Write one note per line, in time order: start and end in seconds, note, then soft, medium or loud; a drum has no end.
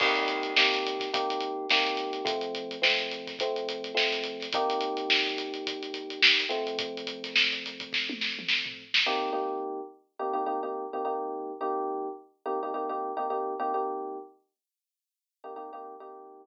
0.00 0.52 C3 medium
0.00 0.52 A#3 medium
0.00 0.52 D#4 medium
0.00 0.52 G4 medium
0.00 kick medium
0.00 crash medium
0.15 snare soft
0.15 closed hi-hat medium
0.28 closed hi-hat medium
0.43 closed hi-hat medium
0.56 1.09 C3 medium
0.56 1.09 A#3 medium
0.56 1.09 D#4 medium
0.56 1.09 G4 medium
0.56 snare medium
0.74 closed hi-hat medium
0.86 closed hi-hat medium
1.00 kick medium
1.00 snare soft
1.00 closed hi-hat medium
1.13 1.65 C3 medium
1.13 1.65 A#3 medium
1.13 1.65 D#4 medium
1.13 1.65 G4 medium
1.13 kick medium
1.13 closed hi-hat medium
1.30 closed hi-hat medium
1.40 closed hi-hat medium
1.69 2.22 C3 medium
1.69 2.22 A#3 medium
1.69 2.22 D#4 medium
1.69 2.22 G4 medium
1.69 snare medium
1.69 closed hi-hat medium
1.86 closed hi-hat medium
1.97 closed hi-hat medium
2.13 closed hi-hat medium
2.25 2.77 F3 loud
2.25 2.77 A3 medium
2.25 2.77 C4 medium
2.25 kick medium
2.25 closed hi-hat medium
2.41 closed hi-hat medium
2.55 closed hi-hat medium
2.71 closed hi-hat medium
2.82 3.34 F3 medium
2.82 3.34 A3 medium
2.82 3.34 C4 medium
2.82 snare medium
2.98 snare soft
2.98 closed hi-hat medium
3.11 closed hi-hat medium
3.27 kick medium
3.27 snare soft
3.27 closed hi-hat medium
3.39 3.92 F3 medium
3.39 3.92 A3 medium
3.39 3.92 C4 medium
3.39 kick medium
3.39 closed hi-hat medium
3.56 closed hi-hat medium
3.69 closed hi-hat medium
3.84 closed hi-hat medium
3.94 4.46 F3 medium
3.94 4.46 A3 medium
3.94 4.46 C4 medium
3.94 snare medium
4.12 snare soft
4.12 closed hi-hat medium
4.24 closed hi-hat medium
4.40 snare soft
4.40 closed hi-hat medium
4.52 6.44 C3 medium
4.52 6.44 A#3 medium
4.52 6.44 D#4 loud
4.52 6.44 G4 medium
4.52 kick medium
4.52 closed hi-hat medium
4.70 closed hi-hat medium
4.81 closed hi-hat medium
4.97 closed hi-hat medium
5.10 snare medium
5.26 closed hi-hat medium
5.38 closed hi-hat medium
5.54 closed hi-hat medium
5.67 kick medium
5.67 closed hi-hat medium
5.83 closed hi-hat medium
5.94 closed hi-hat medium
6.10 closed hi-hat medium
6.22 snare loud
6.40 closed hi-hat medium
6.49 8.82 F3 medium
6.49 8.82 A3 medium
6.49 8.82 C4 medium
6.49 closed hi-hat medium
6.67 closed hi-hat medium
6.79 kick medium
6.79 closed hi-hat medium
6.97 closed hi-hat medium
7.07 closed hi-hat medium
7.24 snare soft
7.24 closed hi-hat medium
7.36 snare medium
7.52 closed hi-hat medium
7.65 snare soft
7.65 closed hi-hat medium
7.80 kick medium
7.80 closed hi-hat medium
7.93 kick medium
7.93 snare medium
8.09 high tom medium
8.21 snare medium
8.39 mid tom medium
8.48 snare medium
8.66 floor tom medium
8.94 snare medium
9.06 9.30 C3 loud
9.06 9.30 A#3 medium
9.06 9.30 D#4 medium
9.06 9.30 G4 medium
9.33 9.80 C3 medium
9.33 9.80 A#3 medium
9.33 9.80 D#4 medium
9.33 9.80 G4 medium
10.19 10.33 C3 medium
10.19 10.33 A#3 medium
10.19 10.33 D#4 medium
10.19 10.33 G4 medium
10.33 10.43 C3 medium
10.33 10.43 A#3 medium
10.33 10.43 D#4 medium
10.33 10.43 G4 medium
10.46 10.59 C3 medium
10.46 10.59 A#3 medium
10.46 10.59 D#4 medium
10.46 10.59 G4 medium
10.63 10.85 C3 medium
10.63 10.85 A#3 medium
10.63 10.85 D#4 medium
10.63 10.85 G4 medium
10.93 11.03 C3 medium
10.93 11.03 A#3 medium
10.93 11.03 D#4 medium
10.93 11.03 G4 medium
11.05 11.52 C3 medium
11.05 11.52 A#3 medium
11.05 11.52 D#4 medium
11.05 11.52 G4 medium
11.61 12.08 C3 medium
11.61 12.08 A#3 medium
11.61 12.08 D#4 medium
11.61 12.08 G4 medium
12.46 12.59 C3 medium
12.46 12.59 A#3 medium
12.46 12.59 D#4 medium
12.46 12.59 G4 medium
12.63 12.72 C3 medium
12.63 12.72 A#3 medium
12.63 12.72 D#4 medium
12.63 12.72 G4 medium
12.74 12.87 C3 medium
12.74 12.87 A#3 medium
12.74 12.87 D#4 medium
12.74 12.87 G4 medium
12.89 13.11 C3 medium
12.89 13.11 A#3 medium
12.89 13.11 D#4 medium
12.89 13.11 G4 medium
13.17 13.26 C3 medium
13.17 13.26 A#3 medium
13.17 13.26 D#4 medium
13.17 13.26 G4 medium
13.30 13.54 C3 medium
13.30 13.54 A#3 medium
13.30 13.54 D#4 medium
13.30 13.54 G4 medium
13.60 13.73 C3 medium
13.60 13.73 A#3 medium
13.60 13.73 D#4 medium
13.60 13.73 G4 medium
13.74 14.17 C3 medium
13.74 14.17 A#3 medium
13.74 14.17 D#4 medium
13.74 14.17 G4 medium
15.44 15.53 C3 medium
15.44 15.53 A#3 medium
15.44 15.53 D#4 medium
15.44 15.53 G4 medium
15.56 15.69 C3 medium
15.56 15.69 A#3 medium
15.56 15.69 D#4 medium
15.56 15.69 G4 medium
15.73 15.94 C3 medium
15.73 15.94 A#3 medium
15.73 15.94 D#4 medium
15.73 15.94 G4 medium
16.00 16.44 C3 medium
16.00 16.44 A#3 medium
16.00 16.44 D#4 medium
16.00 16.44 G4 medium